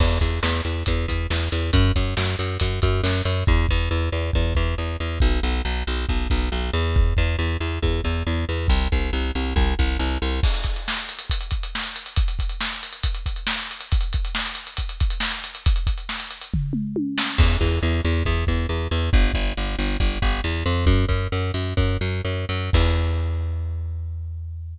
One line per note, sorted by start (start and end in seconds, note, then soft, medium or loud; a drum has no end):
0.00 0.19 E2 medium
0.00 kick loud
0.00 crash loud
0.21 0.40 E2 medium
0.21 kick medium
0.21 closed hi-hat medium
0.43 0.61 E2 medium
0.43 snare loud
0.65 0.83 E2 medium
0.65 closed hi-hat medium
0.86 1.06 E2 medium
0.86 kick medium
0.86 closed hi-hat loud
1.08 1.27 E2 medium
1.08 kick medium
1.08 closed hi-hat medium
1.30 1.49 E2 medium
1.30 snare loud
1.52 1.71 E2 medium
1.52 closed hi-hat medium
1.73 1.92 F#2 medium
1.73 kick loud
1.73 closed hi-hat loud
1.96 2.14 F#2 medium
1.96 kick medium
1.96 closed hi-hat medium
2.17 2.36 F#2 medium
2.17 snare loud
2.39 2.58 F#2 medium
2.39 closed hi-hat medium
2.60 2.80 F#2 medium
2.60 kick medium
2.60 closed hi-hat loud
2.82 3.01 F#2 medium
2.82 kick medium
2.82 closed hi-hat medium
3.04 3.22 F#2 medium
3.04 snare loud
3.25 3.44 F#2 medium
3.25 closed hi-hat medium
3.47 3.66 E2 medium
3.47 kick loud
3.69 3.89 E2 medium
3.69 kick medium
3.91 4.09 E2 medium
4.12 4.31 E2 medium
4.33 4.54 E2 medium
4.33 kick loud
4.55 4.75 E2 medium
4.55 kick medium
4.78 4.97 E2 medium
5.00 5.19 E2 medium
5.20 5.40 B1 medium
5.20 kick loud
5.43 5.62 B1 medium
5.65 5.83 B1 medium
5.87 6.06 B1 medium
6.09 6.28 B1 medium
6.09 kick loud
6.30 6.49 B1 medium
6.30 kick medium
6.52 6.70 B1 medium
6.73 7.14 E2 medium
6.96 kick loud
7.17 7.36 E2 medium
7.17 kick medium
7.39 7.57 E2 medium
7.61 7.79 E2 medium
7.83 8.01 E2 medium
7.83 kick medium
8.04 8.23 E2 medium
8.04 kick medium
8.27 8.45 E2 medium
8.49 8.67 E2 medium
8.68 8.88 C2 medium
8.68 kick loud
8.92 9.11 C2 medium
8.92 kick medium
9.13 9.31 C2 medium
9.35 9.54 C2 medium
9.56 9.74 C2 medium
9.56 kick loud
9.79 9.97 C2 medium
9.79 kick medium
9.99 10.18 C2 medium
10.22 10.40 C2 medium
10.43 kick loud
10.43 crash loud
10.54 closed hi-hat medium
10.64 kick medium
10.64 closed hi-hat medium
10.76 closed hi-hat medium
10.88 snare loud
10.97 closed hi-hat medium
11.09 closed hi-hat medium
11.19 closed hi-hat medium
11.30 kick medium
11.30 closed hi-hat loud
11.41 closed hi-hat medium
11.51 kick medium
11.51 closed hi-hat medium
11.63 closed hi-hat medium
11.75 snare loud
11.84 closed hi-hat medium
11.96 closed hi-hat medium
12.06 closed hi-hat medium
12.16 kick loud
12.16 closed hi-hat loud
12.28 closed hi-hat medium
12.39 kick medium
12.39 closed hi-hat medium
12.49 closed hi-hat medium
12.61 snare loud
12.71 closed hi-hat medium
12.83 closed hi-hat medium
12.93 closed hi-hat medium
13.03 kick medium
13.03 closed hi-hat loud
13.15 closed hi-hat medium
13.26 kick medium
13.26 closed hi-hat medium
13.36 closed hi-hat medium
13.47 snare loud
13.59 closed hi-hat medium
13.71 closed hi-hat medium
13.81 closed hi-hat medium
13.92 kick loud
13.92 closed hi-hat loud
14.01 closed hi-hat medium
14.13 kick medium
14.13 closed hi-hat medium
14.25 closed hi-hat medium
14.35 snare loud
14.46 closed hi-hat medium
14.55 closed hi-hat medium
14.67 closed hi-hat medium
14.77 kick medium
14.77 closed hi-hat loud
14.89 closed hi-hat medium
15.00 kick loud
15.00 closed hi-hat medium
15.10 closed hi-hat medium
15.20 snare loud
15.31 closed hi-hat medium
15.44 closed hi-hat medium
15.55 closed hi-hat medium
15.66 kick loud
15.66 closed hi-hat loud
15.76 closed hi-hat medium
15.87 kick medium
15.87 closed hi-hat medium
15.98 closed hi-hat medium
16.09 snare loud
16.20 closed hi-hat medium
16.31 closed hi-hat medium
16.41 closed hi-hat medium
16.54 kick medium
16.54 floor tom medium
16.73 mid tom medium
16.96 high tom medium
17.18 snare loud
17.38 17.57 E2 medium
17.38 kick loud
17.38 crash loud
17.61 17.79 E2 medium
17.61 kick medium
17.83 18.01 E2 medium
18.05 18.23 E2 medium
18.25 18.45 E2 medium
18.25 kick medium
18.47 18.67 E2 medium
18.47 kick medium
18.69 18.88 E2 medium
18.91 19.10 E2 medium
19.13 19.32 G1 medium
19.13 kick loud
19.34 19.53 G1 medium
19.34 kick medium
19.57 19.76 G1 medium
19.79 19.97 G1 medium
20.00 20.18 G1 medium
20.00 kick medium
20.22 20.41 G1 medium
20.22 kick medium
20.44 20.64 E2 medium
20.66 20.85 F2 medium
20.86 21.05 F#2 medium
20.86 kick loud
21.09 21.28 F#2 medium
21.09 kick medium
21.32 21.51 F#2 medium
21.54 21.74 F#2 medium
21.77 21.97 F#2 medium
21.77 kick medium
22.01 22.21 F#2 medium
22.25 22.45 F#2 medium
22.49 22.70 F#2 medium
22.73 24.78 E2 medium
22.73 kick loud
22.73 crash loud